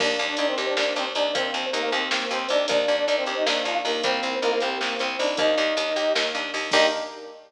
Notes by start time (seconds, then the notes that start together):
0.00 D#2 A#3 D4 D5, kick, crash
0.19 D#2 D4, closed hi-hat
0.29 D4 D5
0.37 D#2 D4 D#4 D5, closed hi-hat
0.48 C4 C5
0.58 D#2 G4, closed hi-hat
0.67 D4 D5
0.77 D#2 A#3 D4 D5, snare
0.96 D#2 C4 D4 C5, closed hi-hat
1.15 D#2 D4 D#4 D5, closed hi-hat
1.35 D#2 A#3 C4 C5, kick, closed hi-hat
1.54 D#2 C4, closed hi-hat
1.73 D#2 A#3 D#4 A#4, closed hi-hat
1.83 A#3 A#4
1.92 D#2 C4 G4 C5, closed hi-hat
2.11 D#2 A#3, snare
2.31 D#2 C4 C5, closed hi-hat
2.49 D#2 D4 D#4 D5, closed hi-hat
2.68 D#2 A#3 D4 D5, kick, closed hi-hat
2.88 D#2 D4, closed hi-hat
2.98 D4 D5
3.08 D#2 D4 D#4 D5, closed hi-hat
3.17 C4 C5
3.26 D#2 G4, closed hi-hat
3.37 D#4 D#5
3.46 D#2 A#3 D4 D5, snare
3.65 D#2 D4 F4 F5, closed hi-hat
3.85 D#2 A#3 D#4 A#4, open hi-hat
4.04 C2 A#3 C4 C5, kick, closed hi-hat
4.23 C2 C4, closed hi-hat
4.42 C2 A#3 D#4 A#4, closed hi-hat
4.52 A#3 A#4
4.60 C2 C4 G4 C5, closed hi-hat
4.81 C2 A#3, snare
4.99 C2 C4 C5, closed hi-hat
5.19 C2 D4 D#4 D5, open hi-hat
5.37 D#2 A#3 D#4 D#5, kick, closed hi-hat
5.57 D#2 D4, closed hi-hat
5.77 D#2 D#4, closed hi-hat
5.96 D#2 G4, closed hi-hat
6.15 D#2 A#3, snare
6.35 D#2 D4, closed hi-hat
6.54 D#2 D#4, open hi-hat
6.71 D#2 A#3 D4 D#4 G4 D#5, kick, crash